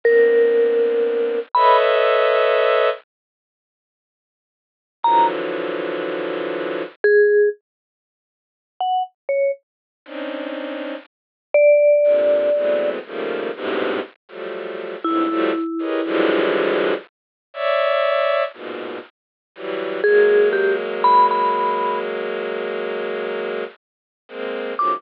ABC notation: X:1
M:5/4
L:1/16
Q:1/4=60
K:none
V:1 name="Violin"
[_B,=B,CD]6 [AB_d_e=e]6 z8 | [D,E,F,_G,]8 z12 | [C_D=D_E]4 z4 [_B,,C,D,]2 [=E,_G,_A,=A,=B,C]2 [_D,_E,F,=G,A,_B,]2 [G,,_A,,=A,,=B,,C,]2 z [F,_G,=G,A,]3 | [F,,G,,_A,,=A,,] [F,_G,=G,A,] z [G_A_B=B_d_e] [=D,=E,F,_G,=G,_A,]4 z2 [_d=d=e]4 [_A,,_B,,=B,,]2 z2 [E,_G,=G,]2 |
[_G,_A,_B,]16 z [A,B,C]2 [=A,,=B,,_D,_E,F,G,] |]
V:2 name="Vibraphone"
_B6 =b z13 | _b z7 _A2 z5 _g z _d z2 | z6 d6 z8 | E6 z14 |
_A2 G z b b3 z11 d' |]